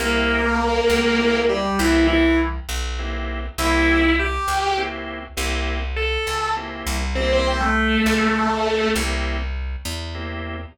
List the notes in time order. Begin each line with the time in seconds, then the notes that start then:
0.00 C2 A#3 C4 E4 G4 A#4
0.90 C#2
1.19 A#3 C4 E4 G4
1.49 G3 G4
1.79 C2 E3 A#3 C4 E4 G4
2.07 E3 E4
2.69 B1
2.99 A#3 C4 E4 G4
3.58 C2 A#3 C4 E4 G4 E5
4.19 G4 G5
4.48 C#2
4.77 A#3 C4 E4 G4
5.37 C2 A#3 C4 E4 G4
5.96 A4 A5
6.27 C#2
6.56 A#3 C4 E4 G4
6.87 C2
7.15 A#3 C4 E4 G4 C5
7.33 C4 C5
7.47 C4 C5
7.60 A3 A4
8.06 C#2
8.95 C2 A#3 C4 E4 G4
9.85 E2
10.15 A#3 C4 E4 G4